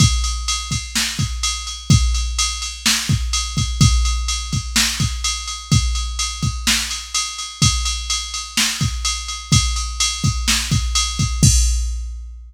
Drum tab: CC |--------|--------|--------|--------|
RD |xxxx-xxx|xxxx-xxx|xxxx-xxx|xxxx-xxx|
SD |----o---|----o---|----o---|----o---|
BD |o--o-o--|o----o-o|o--o-o--|o--o----|

CC |--------|--------|x-------|
RD |xxxx-xxx|xxxx-xxx|--------|
SD |----o---|----o---|--------|
BD |o----o--|o--o-o-o|o-------|